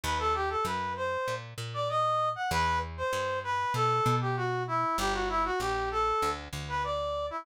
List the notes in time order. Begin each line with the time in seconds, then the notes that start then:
0.03 D#2 B4
0.19 A4
0.35 G4
0.50 A4
0.65 F#2 B4
0.97 C5
1.28 A#2
1.58 A#2
1.74 D5
1.89 D#5
2.36 F#5
2.51 E2 B4
2.97 C5
3.13 G2
3.44 B4
3.74 B2 A4
4.06 B2
4.21 G4
4.37 F#4
4.68 E4
4.98 G1 G4
5.14 F#4
5.29 E4
5.45 F#4
5.60 A#1 G4
5.91 A4
6.22 D2
6.53 D2
6.69 B4
6.84 D5
7.31 E4